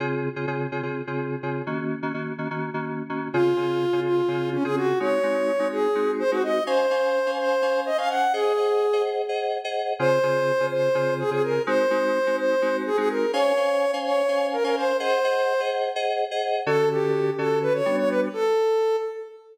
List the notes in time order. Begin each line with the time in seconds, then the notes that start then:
0.00 C#3 C4 F4 G#4
0.36 C#3 C4 F4 G#4
0.47 C#3 C4 F4 G#4
0.72 C#3 C4 F4 G#4
0.83 C#3 C4 F4 G#4
1.07 C#3 C4 F4 G#4
1.43 C#3 C4 F4 G#4
1.67 D#3 A#3 C#4 F#4
2.02 D#3 A#3 C#4 F#4
2.14 D#3 A#3 C#4 F#4
2.38 D#3 A#3 C#4 F#4
2.51 D#3 A#3 C#4 F#4
2.74 D#3 A#3 C#4 F#4
3.09 D#3 A#3 C#4 F#4
3.33 C#3 C4 F4 G#4
3.57 C#3 C4 F4 G#4
3.93 C#3 C4 F4 G#4
4.05 F4
4.28 C#3 C4 F4 G#4
4.52 C#4
4.64 C#3 C4 F4 G#4
4.76 F#4
5.00 G#3 C4 D#4 F#4 C#5
5.23 G#3 C4 D#4 F#4
5.59 G#3 C4 D#4 F#4
5.72 G#4
5.95 G#3 C4 D#4 F#4
6.19 C5
6.31 G#3 C4 D#4 F#4
6.43 D#5
6.67 C#4 C5 F5 G#5
6.90 C#4 C5 F5 G#5
7.26 C#4 C5 F5 G#5
7.38 C5
7.62 C#4 C5 F5 G#5
7.86 D#5
7.98 C#4 C5 F5 G#5
8.09 F#5
8.33 G#4 C5 D#5 F#5
8.57 G#4 C5 D#5 F#5
8.93 G#4 C5 D#5 F#5
9.29 G#4 C5 D#5 F#5
9.64 G#4 C5 D#5 F#5
9.99 C#3 C4 F4 G#4 C5
10.23 C#3 C4 F4 G#4
10.60 C#3 C4 F4 G#4
10.71 C5
10.95 C#3 C4 F4 G#4
11.19 G#4
11.31 C#3 C4 F4 G#4
11.43 A#4
11.67 G#3 C4 D#4 F#4 C5
11.90 G#3 C4 D#4 F#4
12.27 G#3 C4 D#4 F#4
12.38 C5
12.62 G#3 C4 D#4 F#4
12.86 G#4
12.97 G#3 C4 D#4 F#4 G#4
13.10 A#4
13.33 C#4 C5 C#5 F5 G#5
13.57 C#4 C5 F5 G#5
13.93 C#4 C5 F5 G#5
14.05 C#5
14.28 C#4 C5 F5 G#5
14.52 A#4
14.64 C#4 A#4 C5 F5 G#5
14.76 C5
15.00 G#4 C5 D#5 F#5
15.24 G#4 C5 D#5 F#5
15.60 G#4 C5 D#5 F#5
15.96 G#4 C5 D#5 F#5
16.31 G#4 C5 D#5 F#5
16.66 D3 C#4 F#4 A4
16.91 G4
17.38 D3 C#4 F#4 A4
17.62 B4
17.73 C#5
17.86 G3 B3 D4 F#4
17.98 C#5
18.09 B4
18.33 A4